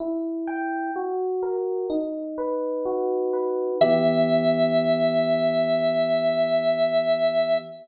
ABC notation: X:1
M:4/4
L:1/8
Q:1/4=63
K:Em
V:1 name="Drawbar Organ"
z8 | e8 |]
V:2 name="Electric Piano 1"
E g F ^A ^D B F B | [E,B,G]8 |]